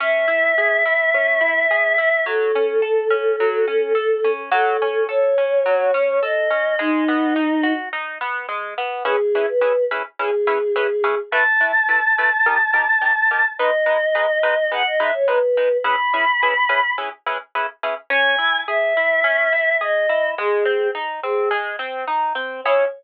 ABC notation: X:1
M:4/4
L:1/16
Q:1/4=106
K:C#m
V:1 name="Choir Aahs"
e16 | A16 | A4 c8 d4 | D8 z8 |
G3 B3 z2 G8 | a16 | d8 f d e c B4 | b8 z8 |
g4 e8 d4 | G4 z2 G2 z8 | c4 z12 |]
V:2 name="Orchestral Harp"
C2 E2 G2 E2 C2 E2 G2 E2 | F,2 C2 A2 C2 F,2 C2 A2 C2 | F,2 C2 A2 C2 F,2 C2 A2 C2 | G,2 B,2 D2 F2 D2 B,2 G,2 B,2 |
[CEGB]2 [CEGB]2 [CEGB]2 [CEGB]2 [CEGB]2 [CEGB]2 [CEGB]2 [CEGB]2 | [A,EB]2 [A,EB]2 [A,EB]2 [A,EB]2 [D=G^A]2 [DGA]2 [DGA]2 [DGA]2 | [G,DB]2 [G,DB]2 [G,DB]2 [G,DB]2 [G,DB]2 [G,DB]2 [G,DB]2 [G,DB]2 | [CEGB]2 [CEGB]2 [CEGB]2 [CEGB]2 [CEGB]2 [CEGB]2 [CEGB]2 [CEGB]2 |
C2 E2 G2 E2 C2 E2 G2 E2 | G,2 ^B,2 D2 B,2 G,2 B,2 D2 B,2 | [CEG]4 z12 |]